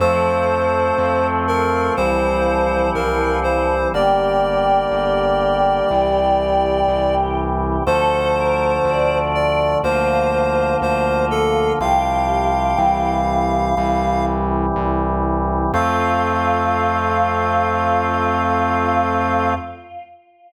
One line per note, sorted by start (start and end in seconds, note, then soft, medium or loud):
0.00 0.88 F2 medium
0.00 3.72 F3 medium
0.00 1.96 F3 loud
0.00 1.96 A3 loud
0.00 1.96 C4 medium
0.00 1.27 C5 loud
0.98 1.87 F2 medium
1.48 1.93 A#4 medium
1.97 2.86 C2 medium
1.97 3.92 E3 medium
1.97 3.92 G3 loud
1.97 3.92 C4 medium
1.97 2.90 C5 loud
2.95 3.83 C2 medium
2.95 3.39 A#4 medium
3.43 3.88 C5 medium
3.93 4.82 G1 medium
3.93 5.89 D3 medium
3.93 5.88 G3 medium
3.93 5.89 A#3 medium
3.93 7.38 G4 medium
3.93 7.15 D5 loud
4.91 5.80 G1 medium
5.89 6.79 C2 medium
5.89 7.84 C3 medium
5.89 7.84 E3 medium
5.89 7.84 G3 medium
6.88 7.77 C2 medium
7.86 8.76 D2 medium
7.86 9.82 D3 loud
7.86 9.82 F3 loud
7.86 9.82 A3 medium
7.86 8.31 A4 medium
7.86 9.19 C5 loud
8.36 8.76 A#4 medium
8.85 9.73 D2 medium
8.85 9.68 D5 medium
9.35 9.78 D5 medium
9.83 10.72 D2 medium
9.83 11.79 D3 medium
9.83 11.79 F3 loud
9.83 11.79 A#3 medium
9.83 11.71 F4 medium
9.83 10.76 C5 loud
10.82 11.70 D2 medium
10.82 11.25 C5 loud
11.31 11.73 A4 loud
11.80 12.71 C2 medium
11.80 12.77 C3 loud
11.80 12.78 F3 loud
11.80 12.77 G3 medium
11.80 13.09 G4 medium
11.80 14.25 F5 loud
12.78 13.69 C2 medium
12.78 13.75 C3 loud
12.78 13.75 E3 loud
12.78 13.75 G3 loud
13.77 14.66 C2 medium
13.77 15.72 C3 medium
13.77 15.72 E3 loud
13.77 15.72 G3 loud
14.76 15.64 C2 medium
15.73 19.54 F2 loud
15.73 19.54 F3 medium
15.73 19.54 A3 loud
15.73 19.54 C4 loud
15.73 19.53 F4 loud
15.73 19.54 F5 loud